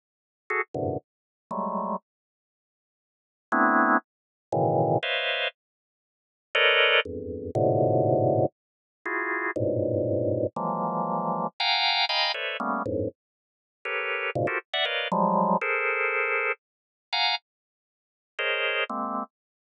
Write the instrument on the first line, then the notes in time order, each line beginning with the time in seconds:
drawbar organ
0.50 F#4 G#4 A4
0.74 F#2 G2 G#2 A#2 C3 D3
1.51 F#3 G3 G#3 A3
3.52 A3 B3 C4 D4 E4
4.52 A2 B2 C#3 D#3 E3
5.03 B4 C5 C#5 D#5 E5 F5
6.55 A4 A#4 B4 C#5 D5 D#5
7.05 E2 F2 G2
7.55 G#2 A2 A#2 B2 C3 D3
9.05 E4 F4 F#4 G#4
9.56 G2 G#2 A2 A#2 B2
10.56 E3 F3 F#3 G#3 A#3
11.60 F5 F#5 G5 G#5 A#5
12.09 D#5 F5 G5 G#5 A#5 B5
12.34 A4 B4 C5 C#5 D5 E5
12.60 G3 A3 A#3 B3 C#4
12.86 F2 G2 G#2 A2
13.85 G4 A4 A#4 B4 C#5
14.35 G#2 A#2 B2 C#3
14.47 F4 F#4 G4 A4 A#4 C5
14.73 D5 E5 F#5
14.85 A#4 B4 C#5 D5 D#5 F5
15.12 F3 F#3 G3 G#3
15.61 G#4 A4 A#4 C5
17.13 F5 F#5 G#5 A#5
18.39 G#4 A#4 C5 C#5 D#5
18.89 G#3 A#3 C4